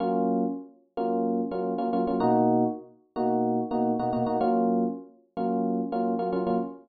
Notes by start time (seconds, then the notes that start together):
0.00 F#3 A#3 C#4 F4
0.97 F#3 A#3 C#4 F4
1.51 F#3 A#3 C#4 F4
1.78 F#3 A#3 C#4 F4
1.93 F#3 A#3 C#4 F4
2.07 F#3 A#3 C#4 F4
2.20 B2 A#3 D#4 F#4
3.16 B2 A#3 D#4 F#4
3.71 B2 A#3 D#4 F#4
3.99 B2 A#3 D#4 F#4
4.13 B2 A#3 D#4 F#4
4.26 B2 A#3 D#4 F#4
4.41 F#3 A#3 C#4 F4
5.37 F#3 A#3 C#4 F4
5.92 F#3 A#3 C#4 F4
6.19 F#3 A#3 C#4 F4
6.33 F#3 A#3 C#4 F4
6.47 F#3 A#3 C#4 F4